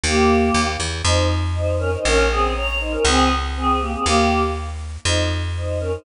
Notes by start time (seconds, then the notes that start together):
0.04 D#2 A#3 G4
0.54 D#2
0.80 E2
1.04 F2 D#4 C5
1.56 D#4 C5
1.79 C#4 A#4
1.93 D#4 C5
2.05 A#1 C#4 A#4
2.30 C4 G#4
2.56 C#5 A#5
2.80 D#4 C5
2.92 C#4 A#4
3.05 C#2 C4 G#4
3.56 C4 G#4
3.80 A#3 G4
3.94 C4 G#4
4.05 D#2 A#3 G4
5.05 F2 D#4 C5
5.56 D#4 C5
5.80 C#4 A#4
5.92 D#4 C5